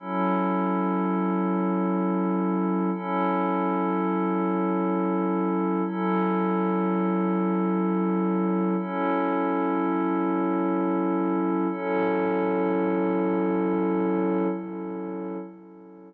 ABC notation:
X:1
M:4/4
L:1/8
Q:"Swing" 1/4=82
K:F#dor
V:1 name="Pad 5 (bowed)"
[F,CEA]8 | [F,CEA]8 | [F,CEA]8 | [F,CEA]8 |
[F,CEA]8 |]